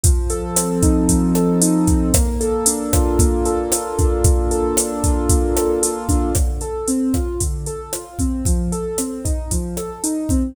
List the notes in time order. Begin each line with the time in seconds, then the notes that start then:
0.04 F3, kick, closed hi-hat
0.30 A4, closed hi-hat
0.56 C4, cross-stick, closed hi-hat
0.83 D#4, kick, closed hi-hat
1.09 F3, kick, closed hi-hat
1.35 A4, cross-stick, closed hi-hat
1.61 D#4, closed hi-hat
1.87 C4, kick, closed hi-hat
2.14 A#3, kick, cross-stick, closed hi-hat
2.41 A4, closed hi-hat
2.66 D4, closed hi-hat
2.93 F4, kick, cross-stick, closed hi-hat
3.19 A#3, kick, closed hi-hat
3.45 A4, closed hi-hat
3.72 F4, cross-stick, closed hi-hat
3.98 D4, kick, closed hi-hat
4.24 A#3, kick, closed hi-hat
4.51 A4, closed hi-hat
4.77 D4, cross-stick, closed hi-hat
5.04 F4, kick, closed hi-hat
5.29 A#3, kick, closed hi-hat
5.56 A4, cross-stick, closed hi-hat
5.83 F4, closed hi-hat
6.09 D4, kick, closed hi-hat
6.35 D3, kick, cross-stick, closed hi-hat
6.61 A4, closed hi-hat
6.88 C4, closed hi-hat
7.14 F4, kick, cross-stick, closed hi-hat
7.40 D3, kick, closed hi-hat
7.66 A4, closed hi-hat
7.93 F4, cross-stick, closed hi-hat
8.19 C4, kick, closed hi-hat
8.45 F3, kick, closed hi-hat
8.72 A4, closed hi-hat
8.98 C4, cross-stick, closed hi-hat
9.25 D#4, kick, closed hi-hat
9.51 F3, kick, closed hi-hat
9.77 A4, cross-stick, closed hi-hat
10.04 D#4, closed hi-hat
10.29 C4, kick, closed hi-hat